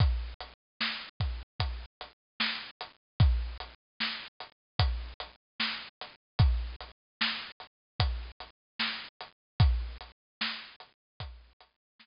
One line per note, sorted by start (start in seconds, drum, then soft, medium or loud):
0.00 kick medium
0.00 closed hi-hat medium
0.40 closed hi-hat medium
0.81 snare medium
1.20 kick medium
1.20 closed hi-hat medium
1.60 kick medium
1.60 closed hi-hat medium
2.01 closed hi-hat medium
2.40 snare loud
2.81 closed hi-hat medium
3.20 kick loud
3.20 closed hi-hat medium
3.60 closed hi-hat medium
4.00 snare medium
4.40 closed hi-hat medium
4.79 kick medium
4.79 closed hi-hat loud
5.20 closed hi-hat medium
5.60 snare medium
6.00 snare soft
6.00 closed hi-hat medium
6.39 kick medium
6.39 closed hi-hat medium
6.80 closed hi-hat medium
7.21 snare loud
7.60 closed hi-hat soft
8.00 kick medium
8.00 closed hi-hat medium
8.40 closed hi-hat medium
8.79 snare medium
9.21 closed hi-hat medium
9.60 kick loud
9.60 closed hi-hat medium
10.01 closed hi-hat medium
10.41 snare loud
10.80 closed hi-hat medium
11.20 kick medium
11.20 closed hi-hat loud
11.60 closed hi-hat medium
11.99 snare medium